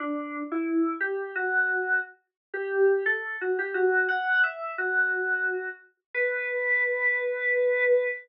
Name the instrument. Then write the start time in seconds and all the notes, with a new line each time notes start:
electric piano 2
0.00 D4
0.52 E4
1.00 G4
1.36 F#4
2.54 G4
3.06 A4
3.41 F#4
3.59 G4
3.74 F#4
4.09 F#5
4.43 E5
4.78 F#4
6.14 B4